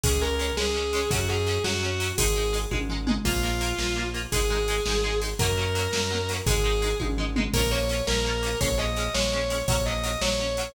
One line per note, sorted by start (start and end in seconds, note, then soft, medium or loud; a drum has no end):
0.03 0.52 C#2 loud
0.03 0.11 G#3 medium
0.03 0.11 C#4 medium
0.03 0.18 G#4 medium
0.03 kick loud
0.03 ride loud
0.21 0.29 G#3 medium
0.21 0.29 C#4 medium
0.21 0.51 A#4 medium
0.39 0.46 G#3 medium
0.39 0.46 C#4 medium
0.39 ride medium
0.57 1.05 C#2 medium
0.57 0.64 G#3 medium
0.57 0.64 C#4 medium
0.57 1.09 G#4 medium
0.57 snare loud
0.74 0.82 G#3 medium
0.74 0.82 C#4 medium
0.93 1.00 G#3 medium
0.93 1.00 C#4 medium
0.93 ride medium
1.11 1.59 F#2 loud
1.11 1.18 F#3 medium
1.11 1.18 C#4 medium
1.11 1.27 F#4 medium
1.11 kick loud
1.11 ride loud
1.29 1.37 F#3 medium
1.29 1.37 C#4 medium
1.29 1.59 G#4 medium
1.47 1.54 F#3 medium
1.47 1.54 C#4 medium
1.47 ride medium
1.64 2.12 F#2 medium
1.64 1.71 F#3 medium
1.64 1.71 C#4 medium
1.64 2.08 F#4 medium
1.64 snare loud
1.83 1.90 F#3 medium
1.83 1.90 C#4 medium
2.00 2.07 F#3 medium
2.00 2.07 C#4 medium
2.00 ride medium
2.18 2.66 G#1 loud
2.18 2.25 G#3 medium
2.18 2.25 D#4 medium
2.18 2.51 G#4 medium
2.18 kick loud
2.18 ride loud
2.36 2.43 G#3 medium
2.36 2.43 D#4 medium
2.53 2.60 G#3 medium
2.53 2.60 D#4 medium
2.53 ride medium
2.71 3.19 G#1 medium
2.71 2.78 G#3 medium
2.71 2.78 D#4 medium
2.71 kick medium
2.71 high tom medium
2.89 2.97 G#3 medium
2.89 2.97 D#4 medium
2.89 floor tom medium
3.07 3.14 G#3 medium
3.07 3.14 D#4 medium
3.07 mid tom loud
3.25 3.73 A#1 loud
3.25 3.32 A#3 medium
3.25 4.02 F4 medium
3.25 3.32 F4 medium
3.25 kick loud
3.25 crash loud
3.43 3.50 A#3 medium
3.43 3.50 F4 medium
3.61 3.68 A#3 medium
3.61 3.68 F4 medium
3.61 ride medium
3.78 4.26 A#1 medium
3.78 3.86 A#3 medium
3.78 3.86 F4 medium
3.78 snare loud
3.96 4.03 A#3 medium
3.96 4.03 F4 medium
4.14 4.21 A#3 medium
4.14 4.21 F4 medium
4.14 ride medium
4.32 4.80 G#1 medium
4.32 4.40 G#3 medium
4.32 4.40 D#4 medium
4.32 5.14 G#4 medium
4.32 kick loud
4.32 ride loud
4.50 4.57 G#3 medium
4.50 4.57 D#4 medium
4.68 4.76 G#3 medium
4.68 4.76 D#4 medium
4.68 ride medium
4.86 5.34 G#1 medium
4.86 4.94 G#3 medium
4.86 4.94 D#4 medium
4.86 snare loud
5.04 5.11 G#3 medium
5.04 5.11 D#4 medium
5.22 5.29 G#3 medium
5.22 5.29 D#4 medium
5.22 ride medium
5.39 5.88 F#2 loud
5.39 5.47 F#3 medium
5.39 5.47 A#3 medium
5.39 6.27 A#4 medium
5.39 kick loud
5.39 ride loud
5.43 5.47 C#4 medium
5.58 5.65 F#3 medium
5.58 5.65 A#3 medium
5.58 5.65 C#4 medium
5.75 5.82 F#3 medium
5.75 5.82 A#3 medium
5.75 5.82 C#4 medium
5.75 ride medium
5.92 6.41 F#2 medium
5.92 5.99 F#3 medium
5.92 5.99 A#3 medium
5.92 5.99 C#4 medium
5.92 snare loud
6.11 6.18 F#3 medium
6.11 6.18 A#3 medium
6.11 6.18 C#4 medium
6.29 6.37 F#3 medium
6.29 6.37 A#3 medium
6.29 ride medium
6.33 6.37 C#4 medium
6.46 6.94 G#1 loud
6.46 6.54 G#3 medium
6.46 6.54 D#4 medium
6.46 6.92 G#4 medium
6.46 kick loud
6.46 ride loud
6.64 6.71 G#3 medium
6.64 6.71 D#4 medium
6.82 6.89 G#3 medium
6.82 6.89 D#4 medium
6.82 ride medium
7.00 7.49 G#1 medium
7.00 7.07 G#3 medium
7.00 7.07 D#4 medium
7.00 kick medium
7.00 high tom medium
7.18 7.25 G#3 medium
7.18 7.25 D#4 medium
7.18 floor tom medium
7.36 7.43 G#3 medium
7.36 7.43 D#4 medium
7.36 mid tom loud
7.53 8.02 A#1 loud
7.53 7.61 A#3 medium
7.53 7.61 C#4 medium
7.53 7.68 A#4 medium
7.53 kick loud
7.53 crash loud
7.58 7.61 F4 medium
7.71 7.79 A#3 medium
7.71 7.79 C#4 medium
7.71 7.79 F4 medium
7.71 8.01 C#5 medium
7.89 7.96 A#3 medium
7.89 7.96 C#4 medium
7.89 7.96 F4 medium
7.89 ride medium
8.07 8.55 A#1 loud
8.07 8.15 A#3 medium
8.07 8.15 C#4 medium
8.07 8.56 A#4 medium
8.07 snare loud
8.11 8.15 F4 medium
8.25 8.32 A#3 medium
8.25 8.32 C#4 medium
8.25 8.32 F4 medium
8.43 8.50 A#3 medium
8.43 8.50 C#4 medium
8.43 8.50 F4 medium
8.43 ride medium
8.61 9.09 A#1 loud
8.61 8.68 G#3 medium
8.61 8.68 C#4 medium
8.61 8.77 C#5 loud
8.61 kick loud
8.61 ride loud
8.78 8.85 G#3 medium
8.78 8.85 C#4 medium
8.78 9.10 D#5 medium
8.96 9.04 G#3 medium
8.96 9.04 C#4 medium
8.96 ride medium
9.14 9.63 A#1 medium
9.14 9.22 G#3 medium
9.14 9.22 C#4 medium
9.14 9.59 C#5 medium
9.14 snare loud
9.32 9.39 G#3 medium
9.32 9.39 C#4 medium
9.50 9.57 G#3 medium
9.50 9.57 C#4 medium
9.50 ride medium
9.68 10.16 A#1 loud
9.68 9.76 F#3 medium
9.68 9.76 C#4 medium
9.68 9.85 C#5 medium
9.68 kick loud
9.68 ride loud
9.86 9.94 F#3 medium
9.86 9.94 C#4 medium
9.86 10.18 D#5 medium
10.04 10.11 F#3 medium
10.04 10.11 C#4 medium
10.04 ride medium
10.21 10.69 A#1 medium
10.21 10.29 F#3 medium
10.21 10.29 C#4 medium
10.21 10.71 C#5 medium
10.21 snare loud
10.39 10.46 F#3 medium
10.39 10.46 C#4 medium
10.57 10.65 F#3 medium
10.57 10.65 C#4 medium
10.57 ride medium